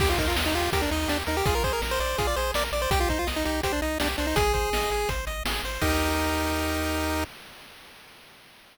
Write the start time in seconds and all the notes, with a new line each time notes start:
0.00 D#2 G4, kick, crash
0.10 F4
0.18 D#2 D#4 A#4, kick, closed hi-hat
0.28 F4
0.35 D#2 D#5, snare
0.46 D#4
0.53 D#2 F4 G4, closed hi-hat
0.72 D#2 G4 A#4, kick, closed hi-hat
0.82 D4
0.91 D#2 D#4 D#5, closed hi-hat
1.08 D#2 D4 G4, snare
1.27 D#2 D#4 A#4, closed hi-hat
1.37 G4
1.46 A#1 F4 G#4, kick, closed hi-hat
1.55 A#4
1.64 A#1 G#4 C5, kick, closed hi-hat
1.73 A#4
1.82 A#1 A#4, snare
1.91 C5
1.99 A#1 C5 D5, closed hi-hat
2.18 A#1 F4 G#4, kick, closed hi-hat
2.27 D5
2.36 A#1 G#4 C5, closed hi-hat
2.54 A#1 A#4 D5, snare
2.72 A#1 D5, closed hi-hat
2.82 C5
2.90 C2 G4, kick, closed hi-hat
3.00 F4
3.08 C2 D#4 C5, kick, closed hi-hat
3.19 F4
3.27 C2 D#5, snare
3.36 D#4
3.45 C2 D#4 G4, closed hi-hat
3.63 C2 G4 C5, kick, closed hi-hat
3.72 D4
3.82 C2 D#4 D#5, closed hi-hat
4.00 C2 D4 G4, snare
4.18 C2 D4 C5, closed hi-hat
4.27 D#4
4.36 G#1 G#4, kick, closed hi-hat
4.54 G#1 C5, kick, closed hi-hat
4.72 G#1 D#5, snare
4.90 G#1 G#4, closed hi-hat
5.09 G#1 C5, kick, closed hi-hat
5.27 G#1 D#5, closed hi-hat
5.45 G#1 G#4, snare
5.63 G#1 C5, closed hi-hat
5.81 D#2 D#4 G4 A#4 D#5, kick, crash